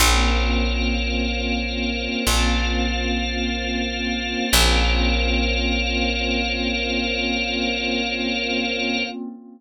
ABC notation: X:1
M:4/4
L:1/8
Q:1/4=53
K:Bbm
V:1 name="Pad 5 (bowed)"
[B,CDF]8 | [B,CDF]8 |]
V:2 name="Drawbar Organ"
[Bcdf]4 [FBcf]4 | [Bcdf]8 |]
V:3 name="Electric Bass (finger)" clef=bass
B,,,4 B,,,4 | B,,,8 |]